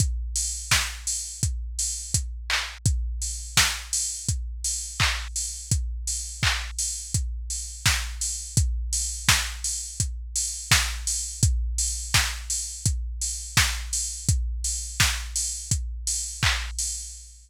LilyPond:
\new DrumStaff \drummode { \time 4/4 \tempo 4 = 84 <hh bd>8 hho8 <bd sn>8 hho8 <hh bd>8 hho8 <hh bd>8 hc8 | <hh bd>8 hho8 <bd sn>8 hho8 <hh bd>8 hho8 <hc bd>8 hho8 | <hh bd>8 hho8 <hc bd>8 hho8 <hh bd>8 hho8 <bd sn>8 hho8 | <hh bd>8 hho8 <bd sn>8 hho8 <hh bd>8 hho8 <bd sn>8 hho8 |
<hh bd>8 hho8 <bd sn>8 hho8 <hh bd>8 hho8 <bd sn>8 hho8 | <hh bd>8 hho8 <bd sn>8 hho8 <hh bd>8 hho8 <hc bd>8 hho8 | }